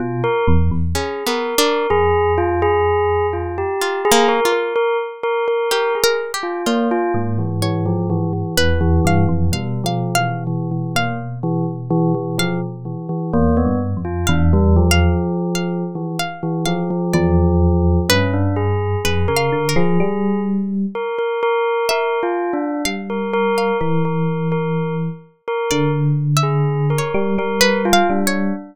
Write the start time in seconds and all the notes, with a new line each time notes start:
0.00 B2 F4
0.24 A#4
0.48 E2
0.71 E2
0.95 C#4 G#4
1.27 B3 A#4
1.58 D4 A#4
1.90 F2 G#4
2.38 F4
2.62 G#4
3.33 F4
3.58 G4
3.82 F4
4.05 G#4
4.12 A#3
4.28 A#4
4.45 F4
4.52 A#4
4.76 A#4
5.23 A#4
5.48 A#4
5.71 G4 A#4
5.95 G#4
6.04 A#4
6.34 G4
6.43 F4
6.66 A#3 F4
6.91 F4
7.14 G#2 A#3
7.38 E3
7.62 E3 C#5
7.86 F3
8.10 E3
8.33 E3
8.57 E2 E3 B4
8.81 E3
9.05 G2 F5
9.28 F2 E3
9.52 B2 G3 F5
9.84 F3 F5
10.15 E3 F5
10.47 E3
10.71 E3
10.95 A#3 F5
11.43 E3
11.90 E3
12.15 E3
12.38 F3 F5
12.85 E3
13.09 E3
13.33 E2 A#3
13.57 B3
13.65 G2
13.97 F2
14.05 F4
14.27 E2 D4 F5
14.53 G3
14.76 F3
14.91 F5
15.55 F5
15.95 E3
16.19 F5
16.43 E3
16.65 F3 F5
16.90 F3
17.13 E2 F3 D5
18.09 G2 C#4 B4
18.33 D4
18.56 G#4
19.05 F2 G#4 B4
19.28 C#3 A#4
19.37 F5
19.52 D3
19.69 A#4
19.76 F3 G#4
20.00 G3
20.95 A#4
21.18 A#4
21.43 A#4
21.89 A#4 E5
22.23 F4
22.53 D4
22.85 G3 F5
23.10 A#4
23.33 A#4
23.58 F5
23.81 E3 A#4
24.05 A#4
24.52 A#4
25.48 A#4
25.71 D3 D5
26.37 E5
26.43 G#4
26.90 A#4
26.98 C#5
27.14 G3
27.38 G3 A#4
27.61 B4
27.85 F4
27.93 F5
28.10 G3 D4
28.27 C#5